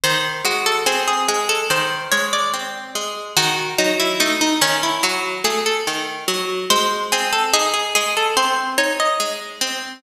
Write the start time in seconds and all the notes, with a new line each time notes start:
0.04 D#3 C5
0.44 G#3 F#4
0.66 A4
0.86 C4 G#4
1.07 G#4
1.28 G#3 G#4
1.49 A4
1.70 D#3 C5
2.11 G#3 C#5
2.33 D5
2.53 C4
2.95 G#3
3.36 D#3 F#4
3.78 F#3 D#4
3.99 E4
4.20 A3 D#4
4.41 D#4
4.61 D#3 C#4
4.83 E4
5.03 F#3 F#4
5.44 A3 G#4
5.66 A4
5.87 D#3
6.28 F#3
6.70 G#3 C5
7.12 C4 G#4
7.32 A4
7.53 D#4 G#4
7.74 G#4
7.95 G#3 G#4
8.17 A4
8.37 C4 C5
8.78 D#4 C#5
9.00 D#5
9.20 G#3
9.61 C4